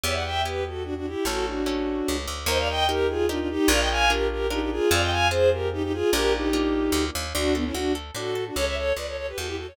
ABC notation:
X:1
M:3/4
L:1/16
Q:1/4=148
K:D
V:1 name="Violin"
[ce] [df] [eg]2 [GB]2 [FA]2 [DF] [DF] [EG]2 | [FA]2 [DF]8 z2 | [K:Eb] [ce] [df] [eg]2 [GB]2 [FA]2 [DF] [DF] [EG]2 | [df] [eg] [fa]2 [GB]2 [GB]2 [EG] [EG] [FA]2 |
[df] [eg] [fa]2 [Ac]2 [GB]2 [EG] [EG] [FA]2 | [GB]2 [EG]8 z2 | [K:D] [DF]2 [B,D] [CE] [DF]2 z2 [FA]3 [DF] | [Ac] [ce] [Ac]2 [Bd] [Ac] [Ac] [GB] [FA] [EG] [FA] [Ac] |]
V:2 name="Orchestral Harp"
[B,EG]4 [B,EG]8 | [A,CE]4 [A,CE]8 | [K:Eb] [EGB]4 [EGB]4 [EGB]4 | [DFB]4 [DFB]4 [DFB]4 |
[CFA]4 [CFA]8 | [B,DF]4 [B,DF]8 | [K:D] D2 A2 F2 A2 D2 A2 | z12 |]
V:3 name="Electric Bass (finger)" clef=bass
E,,12 | A,,,8 C,,2 D,,2 | [K:Eb] E,,12 | B,,,12 |
F,,12 | B,,,8 D,,2 E,,2 | [K:D] D,,4 D,,4 A,,4 | C,,4 C,,4 E,,4 |]